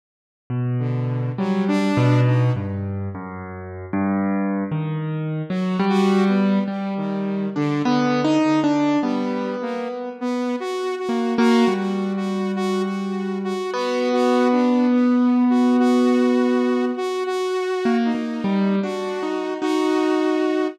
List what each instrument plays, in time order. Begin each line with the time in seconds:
0.50 acoustic grand piano B2
0.79 lead 2 (sawtooth) D3
1.38 lead 2 (sawtooth) F#3, acoustic grand piano G3
1.68 lead 2 (sawtooth) D4
1.97 acoustic grand piano B2
2.26 lead 2 (sawtooth) D#4
2.56 acoustic grand piano G2
3.15 acoustic grand piano F#2
3.93 acoustic grand piano G2
4.72 acoustic grand piano D#3
5.50 acoustic grand piano F#3, lead 2 (sawtooth) F#4
5.79 acoustic grand piano G3
5.89 lead 2 (sawtooth) F#4
6.29 lead 2 (sawtooth) B3
6.68 lead 2 (sawtooth) G3, acoustic grand piano G3
6.97 lead 2 (sawtooth) D#3
7.56 lead 2 (sawtooth) D3, acoustic grand piano D4
7.85 lead 2 (sawtooth) D3, acoustic grand piano B3
8.25 acoustic grand piano D#4
8.44 lead 2 (sawtooth) D3
8.64 acoustic grand piano D4
9.03 lead 2 (sawtooth) G3, acoustic grand piano B3
9.62 lead 2 (sawtooth) A#3
10.21 lead 2 (sawtooth) B3
10.60 lead 2 (sawtooth) F#4
10.99 lead 2 (sawtooth) F#4
11.09 acoustic grand piano A#3
11.38 acoustic grand piano A#3, lead 2 (sawtooth) F#4
11.68 acoustic grand piano G3
11.77 lead 2 (sawtooth) F#4
12.17 lead 2 (sawtooth) F#4
12.56 lead 2 (sawtooth) F#4
12.85 lead 2 (sawtooth) F#4
13.44 lead 2 (sawtooth) F#4
13.74 acoustic grand piano B3, lead 2 (sawtooth) F#4
14.13 lead 2 (sawtooth) F#4
14.52 lead 2 (sawtooth) D4
14.91 lead 2 (sawtooth) B3
15.50 lead 2 (sawtooth) F#4
15.79 lead 2 (sawtooth) F#4
16.97 lead 2 (sawtooth) F#4
17.26 lead 2 (sawtooth) F#4
17.85 acoustic grand piano A#3
18.05 lead 2 (sawtooth) D#4
18.15 acoustic grand piano A#3
18.44 acoustic grand piano G3
18.83 acoustic grand piano D4, lead 2 (sawtooth) F#4
19.23 acoustic grand piano D#4
19.62 acoustic grand piano D#4, lead 2 (sawtooth) F#4